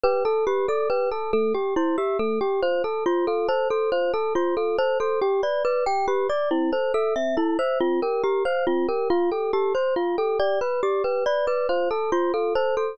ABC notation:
X:1
M:3/4
L:1/8
Q:1/4=139
K:Gmix
V:1 name="Glockenspiel"
B A G A B A | A G E G A G | c A F A c A | c A F A c A |
G d B g G d | E c A e E c | F _B G c F B | F A G c F A |
d B G B d B | c A F A c A |]
V:2 name="Electric Piano 1"
G A B d G A | A, G c e A, G | F A c F A c | F A c F A c |
G B d G B d | C A e C A e | C G _B f C G | F G A c F G |
G B d G B d | F A c F A c |]